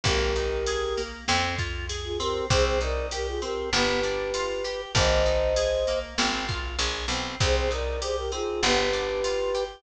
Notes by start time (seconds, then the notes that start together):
0.04 G#1 A#3 G4 A#4, kick, ride
0.36 D#4, ride
0.66 G#4, ride
0.97 A#3, ride
1.28 F2 C4, snare
1.59 F4, kick, ride
1.89 G#4, ride
2.04 F4 G#4
2.19 C4 G4 A#4, ride
2.50 C2 C4 G#4 C5, kick, ride
2.65 G#4 C5
2.81 D#4 A#4 D5, ride
3.11 G4 A#4, ride
3.27 F4 G#4
3.42 C4 G4 A#4, ride
3.73 G1 B3 G4 B4, snare
4.03 D4, ride
4.34 F4, ride
4.64 G4, ride
4.95 G#1 A#3 C5 D#5, kick, ride
5.26 D#4, ride
5.56 G#4, ride
5.87 A#3, ride
6.18 G#1 C4, snare
6.48 F4, kick, ride
6.79 A#1 G#4, ride
7.08 B1 C4, ride
7.40 C2 C4 G#4 C5, kick, ride
7.55 G#4 C5
7.71 D#4 A#4 D5, ride
8.01 G4 G#4 C5, ride
8.17 G4 A#4
8.32 C4 D#4 F4 G#4, ride
8.63 G1 B3 G4 B4, snare
8.93 D4, ride
9.24 F4, ride
9.54 G4, ride